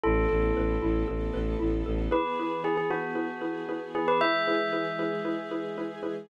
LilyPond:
<<
  \new Staff \with { instrumentName = "Tubular Bells" } { \time 4/4 \key a \lydian \tempo 4 = 115 a'2.~ a'8 r8 | \key e \lydian b'4 gis'16 gis'16 fis'2 gis'16 b'16 | e''1 | }
  \new Staff \with { instrumentName = "Xylophone" } { \time 4/4 \key a \lydian e'8 a'8 b'8 e'8 a'8 b'8 e'8 a'8 | \key e \lydian <e' gis' b'>8 <e' gis' b'>8 <e' gis' b'>8 <e' gis' b'>8 <e' gis' b'>8 <e' gis' b'>8 <e' gis' b'>8 <e' gis' b'>8 | <e' gis' b'>8 <e' gis' b'>8 <e' gis' b'>8 <e' gis' b'>8 <e' gis' b'>8 <e' gis' b'>8 <e' gis' b'>8 <e' gis' b'>8 | }
  \new Staff \with { instrumentName = "Violin" } { \clef bass \time 4/4 \key a \lydian a,,8 a,,8 a,,8 a,,8 a,,8 a,,8 a,,8 a,,8 | \key e \lydian r1 | r1 | }
  \new Staff \with { instrumentName = "String Ensemble 1" } { \time 4/4 \key a \lydian <b e' a'>2 <a b a'>2 | \key e \lydian <e b gis'>1 | <e gis gis'>1 | }
>>